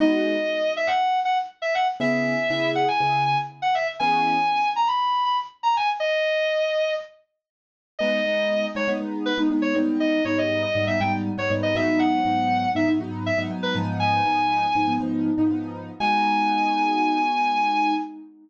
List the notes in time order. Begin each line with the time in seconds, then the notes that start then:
0.00 G#3 B3 D#4 F#4 D#5
0.77 E5
0.87 F#5
1.25 F#5
1.62 E5
1.75 F#5
2.00 C#3 B3 E4 G#4 E5
2.50 C#3 B3 E4 G#4
2.75 F#5
2.88 G#5
3.00 C#3 B3 E4 G#4
3.25 G#5
3.62 F#5
3.75 E5
3.99 E3 B3 C#4 G#4 G#5
4.76 A#5
4.87 B5
5.25 B5
5.63 A#5
5.77 G#5
6.00 D#5
7.99 G#3 B3 D#4 D#5
8.25 G#3 B3 D#4
8.75 G#3 B3 D#4 C#5
8.88 G#3 B3 D#4
9.00 G#3 B3 D#4
9.26 B4
9.38 G#3 B3 D#4
9.50 G#3 B3 D#4
9.62 C#5
9.75 G#2 G3 B3 D#4
10.00 D#5
10.25 G#2 G3 B3 D#4 C#5
10.38 D#5
10.62 D#5
10.75 G#2 G3 B3 D#4
10.87 G#2 G3 B3 D#4 E5
11.00 G#2 G3 B3 D#4 G5
11.37 G#2 G3 B3 D#4 C#5
11.50 G#2 G3 B3 D#4
11.63 D#5
11.75 G#2 F#3 B3 D#4 E5
11.99 F#5
12.25 G#2 F#3 B3 D#4
12.75 G#2 F#3 B3 D#4 E5
12.88 G#2 F#3 B3 D#4
13.00 G#2 F#3 B3 D#4
13.26 E5
13.38 G#2 F#3 B3 D#4
13.50 G#2 F#3 B3 D#4
13.63 B4
13.75 G#2 F3 B3 D#4
14.00 G#5
14.25 G#2 F3 B3 D#4
14.75 G#2 F3 B3 D#4
14.88 G#2 F3 B3 D#4
15.00 G#2 F3 B3 D#4
15.38 G#2 F3 B3 D#4
15.50 G#2 F3 B3 D#4
16.00 G#3 B3 D#4 F#4 G#5